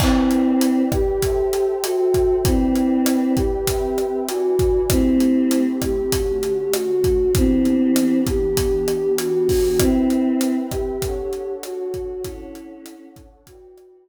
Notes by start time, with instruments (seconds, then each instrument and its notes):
0.00 choir aahs C4 E4, pad 2 (warm) E4 B4 D5 G5, kick, cross-stick, crash
0.31 closed hi-hat
0.61 closed hi-hat
0.92 choir aahs G4, kick, cross-stick, closed hi-hat
1.22 pad 2 (warm) A4 C5 E5 G5, kick, closed hi-hat
1.53 closed hi-hat
1.84 choir aahs F#4, cross-stick, closed hi-hat
2.14 kick, closed hi-hat
2.44 choir aahs C4 E4, pad 2 (warm) E4 B4 D5 G5, kick, closed hi-hat
2.76 closed hi-hat
3.06 cross-stick, closed hi-hat
3.36 choir aahs G4, kick, closed hi-hat
3.67 pad 2 (warm) C4 B4 E5 G5, kick, closed hi-hat
3.98 cross-stick, closed hi-hat
4.27 pad 2 (warm) E4 B4 D5 G#5, choir aahs F#4, closed hi-hat
4.59 kick, closed hi-hat
4.89 pad 2 (warm) A3 C4 E4 G4, choir aahs C4 E4, kick, cross-stick, closed hi-hat
5.20 closed hi-hat
5.51 closed hi-hat
5.82 choir aahs G4, kick, cross-stick, closed hi-hat
6.12 pad 2 (warm) D3 A3 C#4 F#4, kick, closed hi-hat
6.43 closed hi-hat
6.73 choir aahs F#4, cross-stick, closed hi-hat
7.04 kick, closed hi-hat
7.34 pad 2 (warm) E3 B3 D4 G4, choir aahs C4 E4, kick, closed hi-hat
7.65 closed hi-hat
7.96 cross-stick, closed hi-hat
8.27 choir aahs G4, kick, closed hi-hat
8.57 pad 2 (warm) E3 B3 D4 G4, kick, closed hi-hat
8.88 cross-stick, closed hi-hat
9.18 choir aahs F#4, closed hi-hat
9.49 kick, open hi-hat
9.79 choir aahs C4 E4, pad 2 (warm) C4 B4 E5 G5, kick, cross-stick, closed hi-hat
10.10 closed hi-hat
10.41 closed hi-hat
10.71 choir aahs G4, kick, cross-stick, closed hi-hat
11.02 pad 2 (warm) D4 A4 C#5 F#5, kick, closed hi-hat
11.33 closed hi-hat
11.63 choir aahs F#4, cross-stick, closed hi-hat
11.94 kick, closed hi-hat
12.24 choir aahs C#4 E4, pad 2 (warm) D4 A4 C#5 F#5, kick, closed hi-hat
12.55 closed hi-hat
12.86 cross-stick, closed hi-hat
13.16 kick, closed hi-hat
13.47 pad 2 (warm) E4 B4 D5 G5, choir aahs F#4, kick, closed hi-hat
13.77 cross-stick, closed hi-hat